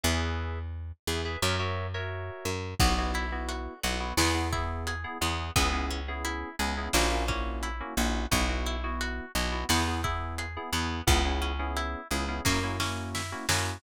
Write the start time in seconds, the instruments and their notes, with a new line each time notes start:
0.03 electric bass (finger) E2, electric piano 2 G#4 B4 E5
1.07 electric bass (finger) E2, electric piano 2 G#4 B4 E5
1.25 electric piano 2 G#4 B4 E5
1.42 electric bass (finger) F#2, electric piano 2 F#4 A#4 C#5 E5
1.59 electric piano 2 F#4 A#4 C#5 E5
1.94 electric piano 2 F#4 A#4 C#5 E5
2.45 electric bass (finger) F#2
2.79 electric bass (finger) B1, electric piano 2 B3 E4 F#4, acoustic guitar (steel) B3, kick, crash
2.98 electric piano 2 B3 E4 F#4
3.14 acoustic guitar (steel) E4, closed hi-hat
3.32 electric piano 2 B3 E4 F#4
3.49 acoustic guitar (steel) F#4, closed hi-hat
3.83 electric bass (finger) B1, acoustic guitar (steel) B3, electric piano 2 B3 E4 F#4, closed hi-hat
4.00 electric piano 2 B3 E4 F#4
4.17 electric bass (finger) E2, acoustic guitar (steel) B3, electric piano 2 B3 E4 G#4, snare
4.34 electric piano 2 B3 E4 G#4
4.52 electric piano 2 B3 E4 G#4, acoustic guitar (steel) E4, kick, closed hi-hat
4.87 acoustic guitar (steel) G#4, closed hi-hat
5.04 electric piano 2 B3 E4 G#4
5.21 electric bass (finger) E2, electric piano 2 B3 E4 G#4, acoustic guitar (steel) B3, closed hi-hat
5.56 electric bass (finger) C#2, acoustic guitar (steel) B3, electric piano 2 B3 C#4 E4 G#4, kick, closed hi-hat
5.73 electric piano 2 B3 C#4 E4 G#4
5.91 acoustic guitar (steel) C#4, closed hi-hat
6.08 electric piano 2 B3 C#4 E4 G#4
6.25 acoustic guitar (steel) E4, closed hi-hat
6.59 electric bass (finger) C#2, electric piano 2 B3 C#4 E4 G#4, acoustic guitar (steel) G#4, closed hi-hat
6.77 electric piano 2 B3 C#4 E4 G#4
6.93 electric bass (finger) A#1, acoustic guitar (steel) A#3, electric piano 2 A#3 C#4 E4 F#4, snare
7.11 electric piano 2 A#3 C#4 E4 F#4
7.28 electric piano 2 A#3 C#4 E4 F#4, acoustic guitar (steel) C#4, kick, closed hi-hat
7.63 acoustic guitar (steel) E4, closed hi-hat
7.80 electric piano 2 A#3 C#4 E4 F#4
7.97 electric bass (finger) A#1, electric piano 2 A#3 C#4 E4 F#4, acoustic guitar (steel) F#4, closed hi-hat
8.31 electric bass (finger) B1, electric piano 2 B3 E4 F#4, acoustic guitar (steel) B3, kick, closed hi-hat
8.49 electric piano 2 B3 E4 F#4
8.66 acoustic guitar (steel) E4, closed hi-hat
8.84 electric piano 2 B3 E4 F#4
9.01 acoustic guitar (steel) F#4, closed hi-hat
9.35 electric bass (finger) B1, electric piano 2 B3 E4 F#4, acoustic guitar (steel) B3, closed hi-hat
9.52 electric piano 2 B3 E4 F#4
9.69 electric bass (finger) E2, electric piano 2 B3 E4 G#4, acoustic guitar (steel) B3, snare
9.87 electric piano 2 B3 E4 G#4
10.04 electric piano 2 B3 E4 G#4, acoustic guitar (steel) E4, kick, closed hi-hat
10.38 acoustic guitar (steel) G#4, closed hi-hat
10.57 electric piano 2 B3 E4 G#4
10.72 electric bass (finger) E2, electric piano 2 B3 E4 G#4, acoustic guitar (steel) B3, closed hi-hat
11.07 electric bass (finger) C#2, electric piano 2 B3 C#4 E4 G#4, acoustic guitar (steel) B3, kick, closed hi-hat
11.25 electric piano 2 B3 C#4 E4 G#4
11.42 acoustic guitar (steel) C#4, closed hi-hat
11.59 electric piano 2 B3 C#4 E4 G#4
11.77 acoustic guitar (steel) E4, closed hi-hat
12.11 electric bass (finger) C#2, electric piano 2 B3 C#4 E4 G#4, acoustic guitar (steel) G#4, closed hi-hat
12.28 electric piano 2 B3 C#4 E4 G#4
12.45 electric bass (finger) F#2, electric piano 2 A#3 C#4 E4 F#4, acoustic guitar (steel) A#3, kick, snare
12.63 electric piano 2 A#3 C#4 E4 F#4
12.80 electric piano 2 A#3 C#4 E4 F#4, acoustic guitar (steel) C#4, snare
13.15 acoustic guitar (steel) E4, snare
13.32 electric piano 2 A#3 C#4 E4 F#4
13.49 electric bass (finger) F#2, electric piano 2 A#3 C#4 E4 F#4, acoustic guitar (steel) F#4, snare